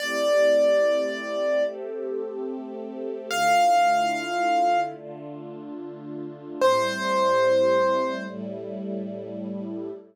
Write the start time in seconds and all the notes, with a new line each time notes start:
0.00 A3 C4 E4 G4 D5
1.65 A3 C4 G4 A4
3.30 D3 A3 E4 F4 F5
4.97 D3 A3 D4 F4
6.61 A2 G3 C4 E4 C5
8.27 A2 G3 A3 E4